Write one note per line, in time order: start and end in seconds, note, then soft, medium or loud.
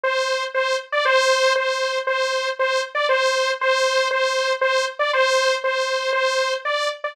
0.03 0.44 C5 loud
0.54 0.77 C5 loud
0.92 1.04 D5 loud
1.05 1.53 C5 loud
1.56 1.99 C5 loud
2.07 2.49 C5 loud
2.59 2.82 C5 loud
2.95 3.07 D5 loud
3.09 3.51 C5 loud
3.61 4.08 C5 loud
4.11 4.53 C5 loud
4.61 4.85 C5 loud
4.99 5.11 D5 loud
5.13 5.56 C5 loud
5.64 6.11 C5 loud
6.13 6.54 C5 loud
6.65 6.89 D5 medium
7.04 7.15 D5 loud